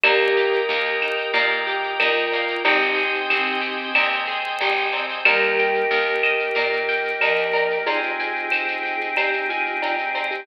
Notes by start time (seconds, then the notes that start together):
0.03 D#2 A#3 G4 A#4 D#5 G5, cowbell, claves, shaker
0.20 shaker
0.36 G4, shaker
0.53 shaker
0.69 D#2 A#3, shaker
0.85 shaker
1.02 D#4, claves, shaker
1.18 shaker
1.34 A#2 A#3, cowbell, shaker
1.51 shaker
1.67 G4, shaker
1.83 shaker
1.99 D#2 D#4 F4 A#4, cowbell, claves, shaker
2.16 shaker
2.32 A#3, cowbell, shaker
2.48 shaker
2.64 G#1 C4 D#4 G4 C5 D#5 G5 G#5, cowbell, shaker
2.81 shaker
2.96 G#4, shaker
3.14 shaker
3.29 G#1 C4, claves, shaker
3.46 shaker
3.61 G4, shaker
3.79 shaker
3.95 D#2 C4, cowbell, claves, shaker
4.12 shaker
4.27 G#4, shaker
4.44 shaker
4.60 G#1 G4, cowbell, shaker
4.76 shaker
4.93 C4, cowbell, shaker
5.09 shaker
5.25 D#2 G3 A#3 D#4 G4 A#4, cowbell, claves, shaker
5.42 shaker
5.58 G5, shaker
5.74 shaker
5.91 D#2 A#4, shaker
6.07 shaker
6.23 D#5, claves, shaker
6.39 shaker
6.55 A#2 A#4, cowbell, shaker
6.72 shaker
6.88 G5, shaker
7.05 shaker
7.21 D#2 F3 A#4 D#5, cowbell, claves, shaker
7.37 shaker
7.53 A#4, cowbell, shaker
7.70 shaker
7.86 C4 D#4 F4 G4 G#4 C5, cowbell, shaker
8.03 shaker
8.19 G#5, shaker
8.35 shaker
8.51 C5, claves, shaker
8.68 shaker
8.83 G5, shaker
9.01 shaker
9.17 G4 C5, cowbell, claves, shaker
9.33 shaker
9.49 F4 G#5, shaker
9.66 shaker
9.82 D#4 G5, cowbell, shaker
9.98 shaker
10.15 C5, cowbell, shaker
10.31 G4, shaker